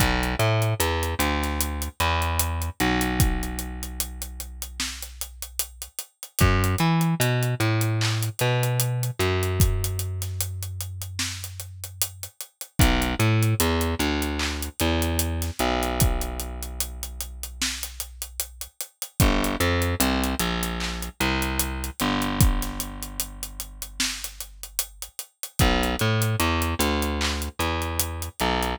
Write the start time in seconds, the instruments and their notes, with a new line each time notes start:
0.00 electric bass (finger) B1, kick, closed hi-hat
0.23 closed hi-hat
0.39 electric bass (finger) A2, closed hi-hat
0.62 closed hi-hat
0.80 electric bass (finger) E2, closed hi-hat
1.03 closed hi-hat
1.19 electric bass (finger) D2, closed hi-hat
1.43 snare, closed hi-hat
1.61 closed hi-hat
1.82 closed hi-hat
2.00 electric bass (finger) E2, closed hi-hat
2.22 closed hi-hat
2.40 closed hi-hat
2.62 closed hi-hat
2.80 electric bass (finger) B1, closed hi-hat
3.01 closed hi-hat
3.20 kick, closed hi-hat
3.43 closed hi-hat
3.59 closed hi-hat
3.83 closed hi-hat
4.00 closed hi-hat
4.22 closed hi-hat
4.40 closed hi-hat
4.62 closed hi-hat
4.80 snare
5.03 closed hi-hat
5.21 closed hi-hat
5.42 closed hi-hat
5.59 closed hi-hat
5.82 closed hi-hat
5.99 closed hi-hat
6.23 closed hi-hat
6.39 electric bass (finger) F#2, kick, closed hi-hat
6.64 closed hi-hat
6.79 electric bass (finger) E3, closed hi-hat
7.01 closed hi-hat
7.20 electric bass (finger) B2, closed hi-hat
7.43 closed hi-hat
7.60 electric bass (finger) A2, closed hi-hat
7.81 closed hi-hat
8.01 clap
8.22 closed hi-hat
8.39 electric bass (finger) B2, snare, closed hi-hat
8.63 closed hi-hat
8.80 closed hi-hat
9.03 closed hi-hat
9.19 electric bass (finger) F#2, closed hi-hat
9.43 closed hi-hat
9.60 kick, closed hi-hat
9.84 closed hi-hat
9.99 closed hi-hat
10.22 snare, closed hi-hat
10.41 closed hi-hat
10.63 closed hi-hat
10.81 closed hi-hat
11.02 closed hi-hat
11.19 snare
11.44 closed hi-hat
11.60 closed hi-hat
11.84 closed hi-hat
12.02 closed hi-hat
12.23 closed hi-hat
12.41 closed hi-hat
12.61 closed hi-hat
12.79 electric bass (finger) B1, kick, closed hi-hat
13.02 closed hi-hat
13.20 electric bass (finger) A2, closed hi-hat
13.43 closed hi-hat
13.60 electric bass (finger) E2, closed hi-hat
13.81 closed hi-hat
13.99 electric bass (finger) D2, closed hi-hat
14.22 closed hi-hat
14.39 clap
14.63 closed hi-hat
14.80 electric bass (finger) E2, closed hi-hat
15.02 closed hi-hat
15.19 closed hi-hat
15.42 snare, closed hi-hat
15.59 electric bass (finger) B1, closed hi-hat
15.83 closed hi-hat
16.00 kick, closed hi-hat
16.21 closed hi-hat
16.40 closed hi-hat
16.63 closed hi-hat
16.80 closed hi-hat
17.03 closed hi-hat
17.21 closed hi-hat
17.43 closed hi-hat
17.62 snare
17.83 closed hi-hat
18.00 closed hi-hat
18.22 closed hi-hat
18.40 closed hi-hat
18.61 closed hi-hat
18.81 closed hi-hat
19.02 closed hi-hat
19.20 electric bass (finger) G1, kick, closed hi-hat
19.44 closed hi-hat
19.60 electric bass (finger) F2, closed hi-hat
19.82 closed hi-hat
20.00 electric bass (finger) C2, closed hi-hat
20.24 closed hi-hat
20.39 electric bass (finger) A#1, closed hi-hat
20.63 closed hi-hat
20.80 clap
21.03 closed hi-hat
21.21 electric bass (finger) C2, closed hi-hat
21.42 closed hi-hat
21.60 closed hi-hat
21.84 closed hi-hat
22.00 electric bass (finger) G1, closed hi-hat
22.22 closed hi-hat
22.41 kick, closed hi-hat
22.62 snare, closed hi-hat
22.80 closed hi-hat
23.03 closed hi-hat
23.20 closed hi-hat
23.43 closed hi-hat
23.60 closed hi-hat
23.82 closed hi-hat
24.00 snare
24.24 closed hi-hat
24.41 closed hi-hat
24.63 closed hi-hat
24.79 closed hi-hat
25.02 closed hi-hat
25.19 closed hi-hat
25.43 closed hi-hat
25.59 electric bass (finger) B1, kick, closed hi-hat
25.83 closed hi-hat
25.99 electric bass (finger) A2, closed hi-hat
26.22 closed hi-hat
26.40 electric bass (finger) E2, closed hi-hat
26.62 closed hi-hat
26.79 electric bass (finger) D2, snare, closed hi-hat
27.02 closed hi-hat
27.21 clap
27.42 closed hi-hat
27.59 electric bass (finger) E2, closed hi-hat
27.82 closed hi-hat
28.00 closed hi-hat
28.22 closed hi-hat
28.40 electric bass (finger) B1, closed hi-hat
28.63 closed hi-hat